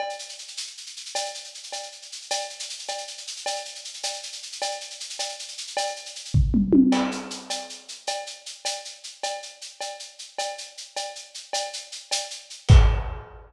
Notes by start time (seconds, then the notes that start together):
0.00 cowbell
0.10 shaker
0.19 shaker
0.29 shaker
0.38 shaker
0.48 shaker
0.57 shaker
0.67 shaker
0.77 shaker
0.86 shaker
0.97 shaker
1.06 shaker
1.15 cowbell, shaker
1.25 shaker
1.35 shaker
1.44 shaker
1.54 shaker
1.63 shaker
1.72 cowbell, shaker
1.83 shaker
1.92 shaker
2.02 shaker
2.12 shaker
2.22 shaker
2.31 cowbell, shaker
2.41 shaker
2.50 shaker
2.59 shaker
2.70 shaker
2.79 shaker
2.88 cowbell, shaker
2.98 shaker
3.07 shaker
3.18 shaker
3.27 shaker
3.36 shaker
3.46 cowbell, shaker
3.56 shaker
3.65 shaker
3.75 shaker
3.85 shaker
3.94 shaker
4.03 cowbell, shaker
4.14 shaker
4.23 shaker
4.33 shaker
4.43 shaker
4.52 shaker
4.62 cowbell, shaker
4.71 shaker
4.81 shaker
4.90 shaker
5.00 shaker
5.10 shaker
5.19 cowbell, shaker
5.29 shaker
5.39 shaker
5.48 shaker
5.58 shaker
5.67 shaker
5.77 cowbell, shaker
5.86 shaker
5.96 shaker
6.06 shaker
6.15 shaker
6.25 shaker
6.34 kick, floor tom
6.54 mid tom
6.73 high tom
6.92 crash, cowbell
7.12 shaker
7.30 shaker
7.50 cowbell, shaker
7.69 shaker
7.88 shaker
8.07 cowbell, shaker
8.27 shaker
8.46 shaker
8.65 cowbell, shaker
8.85 shaker
9.04 shaker
9.23 cowbell, shaker
9.42 shaker
9.61 shaker
9.81 cowbell, shaker
10.00 shaker
10.19 shaker
10.38 cowbell, shaker
10.58 shaker
10.77 shaker
10.96 cowbell, shaker
11.15 shaker
11.34 shaker
11.53 cowbell, shaker
11.73 shaker
11.92 shaker
12.11 cowbell, shaker
12.30 shaker
12.50 shaker
12.69 kick, crash